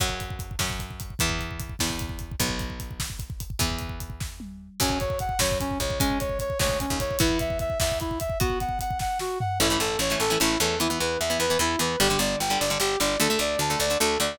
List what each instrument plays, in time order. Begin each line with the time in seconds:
0.00 electric bass (finger) F#2, acoustic guitar (steel) F#3 C#4, kick, crash
0.09 kick
0.20 kick, closed hi-hat
0.30 kick
0.39 kick, closed hi-hat
0.51 kick
0.59 electric bass (finger) F#2, acoustic guitar (steel) F#3 C#4, kick, snare
0.70 kick
0.80 kick, closed hi-hat
0.91 kick
1.00 kick, closed hi-hat
1.10 kick
1.19 electric bass (finger) E2, acoustic guitar (steel) E3 B3, kick, closed hi-hat
1.29 kick
1.39 kick, closed hi-hat
1.51 kick
1.60 kick, closed hi-hat
1.69 kick
1.79 electric bass (finger) E2, acoustic guitar (steel) E3 B3, kick, snare
1.90 kick
1.99 kick, closed hi-hat
2.09 kick
2.19 kick, closed hi-hat
2.31 kick
2.40 electric bass (finger) B1, acoustic guitar (steel) F#3 B3, kick, closed hi-hat
2.49 kick
2.59 kick, closed hi-hat
2.70 kick
2.80 kick, closed hi-hat
2.91 kick
3.00 kick, snare
3.10 kick
3.19 kick, closed hi-hat
3.30 kick
3.40 kick, closed hi-hat
3.50 kick
3.59 electric bass (finger) E2, acoustic guitar (steel) E3 B3, kick, closed hi-hat
3.70 kick
3.79 kick, closed hi-hat
3.89 kick
4.00 kick, closed hi-hat
4.10 kick
4.20 kick, snare
4.40 high tom
4.80 electric bass (finger) F#2, acoustic guitar (steel) F#3 C#4, brass section C#4, kick, crash
4.90 kick
5.00 brass section C#5, kick, closed hi-hat
5.10 kick
5.19 brass section F#5, kick, closed hi-hat
5.29 kick
5.39 electric bass (finger) F#2, acoustic guitar (steel) F#3 C#4, brass section C#5, kick, snare
5.51 kick
5.60 brass section C#4, kick, closed hi-hat
5.71 kick
5.80 electric bass (finger) C#2, brass section C#5, kick, closed hi-hat
5.90 kick
6.00 acoustic guitar (steel) G#3 C#4, brass section C#4, kick, closed hi-hat
6.10 kick
6.20 brass section C#5, kick, closed hi-hat
6.29 kick
6.39 brass section C#5, kick, closed hi-hat
6.50 kick
6.59 electric bass (finger) D2, acoustic guitar (steel) G#3 C#4, brass section C#5, kick, snare
6.69 kick
6.80 brass section C#4, kick, closed hi-hat
6.90 electric bass (finger) D#2, kick
7.00 brass section C#5, kick, closed hi-hat
7.11 kick
7.19 electric bass (finger) E2, acoustic guitar (steel) B3 E4, brass section E4, kick, closed hi-hat
7.29 kick
7.39 brass section E5, kick, closed hi-hat
7.50 kick
7.59 brass section E5, kick, closed hi-hat
7.70 kick
7.80 electric bass (finger) E2, brass section E5, kick, snare
7.92 kick
8.00 brass section E4, kick, closed hi-hat
8.11 kick
8.20 brass section E5, kick, closed hi-hat
8.30 kick
8.40 acoustic guitar (steel) B3 F#4, brass section F#4, kick, closed hi-hat
8.50 kick
8.60 brass section F#5, kick, closed hi-hat
8.69 kick
8.79 brass section F#5, kick, closed hi-hat
8.91 kick
8.99 brass section F#5, kick, snare
9.19 brass section F#4, snare
9.40 brass section F#5, floor tom
9.60 electric bass (finger) A1, acoustic guitar (steel) E3 A3 C#4, brass section E4
9.70 acoustic guitar (steel) E3 A3 C#4
9.80 electric bass (finger) A1, brass section A4
9.99 electric bass (finger) A1, brass section C#5
10.10 acoustic guitar (steel) E3 A3 C#4
10.20 electric bass (finger) A1, brass section A4
10.30 acoustic guitar (steel) E3 A3 C#4
10.40 electric bass (finger) A1, acoustic guitar (steel) E3 A3 C#4, brass section E4
10.60 electric bass (finger) E2, acoustic guitar (steel) E3 A3 C#4, brass section A4
10.80 acoustic guitar (steel) E3 B3, brass section E4
10.90 acoustic guitar (steel) E3 B3
11.00 electric bass (finger) E2, brass section B4
11.20 electric bass (finger) E2, brass section E5
11.30 acoustic guitar (steel) E3 B3
11.40 electric bass (finger) E2, brass section B4
11.50 acoustic guitar (steel) E3 B3
11.59 electric bass (finger) E2, acoustic guitar (steel) E3 B3, brass section E4
11.79 electric bass (finger) E2, acoustic guitar (steel) E3 B3, brass section B4
12.00 electric bass (finger) G1, acoustic guitar (steel) D3 G3, brass section G4
12.10 acoustic guitar (steel) D3 G3
12.19 electric bass (finger) G1, brass section D5
12.40 electric bass (finger) G1, brass section G5
12.50 acoustic guitar (steel) D3 G3
12.60 electric bass (finger) G1, brass section D5
12.70 acoustic guitar (steel) D3 G3
12.80 electric bass (finger) G1, acoustic guitar (steel) D3 G3, brass section G4
13.00 electric bass (finger) G1, acoustic guitar (steel) D3 G3, brass section D5
13.20 electric bass (finger) D2, acoustic guitar (steel) D3 A3, brass section A4
13.30 acoustic guitar (steel) D3 A3
13.39 electric bass (finger) D2, brass section D5
13.59 electric bass (finger) D2, brass section A5
13.70 acoustic guitar (steel) D3 A3
13.80 electric bass (finger) D2, brass section D5
13.90 acoustic guitar (steel) D3 A3
14.00 electric bass (finger) D2, acoustic guitar (steel) D3 A3, brass section A4
14.20 electric bass (finger) D2, acoustic guitar (steel) D3 A3, brass section D5